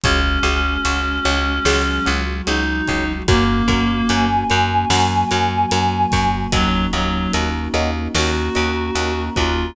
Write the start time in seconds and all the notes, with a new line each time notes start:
0.04 C#2 G#3 C#4 F#4 G#4 C#5, kick, closed hi-hat
0.43 C#2 F#4 G#4 C#5, closed hi-hat
0.85 C#2 F#4 G#4 C#5, closed hi-hat
1.25 C#2 F#4 G#4 C#5, closed hi-hat
1.65 C#2 F#3 G#3 F#4 G#4 C#5, snare
2.06 C#2 F#4 G#4 C#5, closed hi-hat
2.46 C#2 D#4 F#4 G#4 C#5, closed hi-hat
2.88 C#2 F#4 G#4 C#5, kick, closed hi-hat
3.28 F#2 A#3 C#4 F#4 A#4 C#5, kick, closed hi-hat
3.68 F#2 F#4 A#4 C#5, kick, closed hi-hat
4.08 F#2 F#4 A#4 C#5 G#5, closed hi-hat
4.50 F#2 F#4 A#4 C#5, closed hi-hat
4.90 F#2 F#3 A#3 F#4 A#4 C#5, snare
5.31 F#2 F#4 A#4 C#5, closed hi-hat
5.71 F#2 F#4 A#4 C#5, closed hi-hat
6.12 F#2 F#4 A#4 C#5, kick, open hi-hat
6.52 D#2 F#3 A#3 C#4 D#4 F#4 A#4 C#5 D#5, kick, closed hi-hat
6.93 D#2 F#3 F#4 A#4 C#5 D#5, closed hi-hat
7.33 D#2 F#4 A#4 C#5 D#5, closed hi-hat
7.74 D#2 F#4 A#4 C#5 D#5, closed hi-hat
8.14 D#2 A#3 C#4 F#4 A#4 C#5 D#5, snare
8.55 D#2 F#4 A#4 C#5 D#5, closed hi-hat
8.95 D#2 F#4 A#4 C#5 D#5, closed hi-hat
9.36 D#2 F4 F#4 A#4 C#5 D#5, kick, closed hi-hat